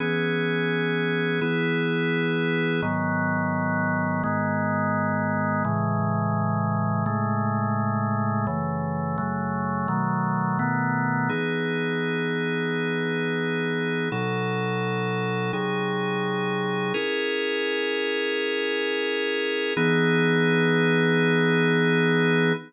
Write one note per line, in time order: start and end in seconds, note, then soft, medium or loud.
0.00 1.40 E3 medium
0.00 1.40 B3 medium
0.00 1.40 C#4 medium
0.00 1.40 G#4 medium
1.41 2.81 E3 medium
1.41 2.81 B3 medium
1.41 2.81 E4 medium
1.41 2.81 G#4 medium
2.82 4.22 G#2 medium
2.82 4.22 D#3 medium
2.82 4.22 F#3 medium
2.82 4.22 B3 medium
4.24 5.63 G#2 medium
4.24 5.63 D#3 medium
4.24 5.63 G#3 medium
4.24 5.63 B3 medium
5.65 7.04 A2 medium
5.65 7.04 C#3 medium
5.65 7.04 E3 medium
5.65 7.04 G#3 medium
7.06 8.46 A2 medium
7.06 8.46 C#3 medium
7.06 8.46 G#3 medium
7.06 8.46 A3 medium
8.47 9.17 F#2 medium
8.47 9.17 C#3 medium
8.47 9.17 E3 medium
8.47 9.17 A3 medium
9.18 9.88 F#2 medium
9.18 9.88 C#3 medium
9.18 9.88 F#3 medium
9.18 9.88 A3 medium
9.88 10.58 B2 medium
9.88 10.58 D#3 medium
9.88 10.58 F#3 medium
9.88 10.58 A3 medium
10.59 11.29 B2 medium
10.59 11.29 D#3 medium
10.59 11.29 A3 medium
10.59 11.29 B3 medium
11.29 14.09 E3 medium
11.29 14.09 B3 medium
11.29 14.09 D#4 medium
11.29 14.09 G#4 medium
14.12 15.52 B2 medium
14.12 15.52 F#3 medium
14.12 15.52 D#4 medium
14.12 15.52 A4 medium
15.53 16.93 C3 medium
15.53 16.93 F#3 medium
15.53 16.93 D#4 medium
15.53 16.93 G#4 medium
16.94 19.74 C#4 medium
16.94 19.74 E4 medium
16.94 19.74 G#4 medium
16.94 19.74 A#4 medium
19.77 22.53 E3 medium
19.77 22.53 B3 loud
19.77 22.53 D#4 medium
19.77 22.53 G#4 medium